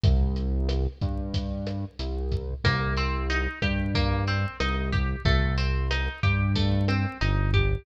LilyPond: <<
  \new Staff \with { instrumentName = "Acoustic Guitar (steel)" } { \time 4/4 \key c \minor \tempo 4 = 92 r1 | bes8 c'8 ees'8 g'8 bes8 c'8 ees'8 g'8 | a8 c'8 ees'8 g'8 a8 c'8 ees'8 g'8 | }
  \new Staff \with { instrumentName = "Synth Bass 1" } { \clef bass \time 4/4 \key c \minor c,4. g,4. c,4 | c,4. g,4. c,4 | c,4. g,4. g,,4 | }
  \new DrumStaff \with { instrumentName = "Drums" } \drummode { \time 4/4 <hh bd>8 hh8 <hh ss>8 <hh bd>8 <hh bd>8 <hh ss>8 hh8 <hh bd>8 | <hh bd ss>8 hh8 hh8 <hh bd ss>8 <hh bd>8 hh8 <hh ss>8 <hh bd>8 | <hh bd>8 hh8 <hh ss>8 <hh bd>8 <hh bd>8 <hh ss>8 hh8 <hh bd>8 | }
>>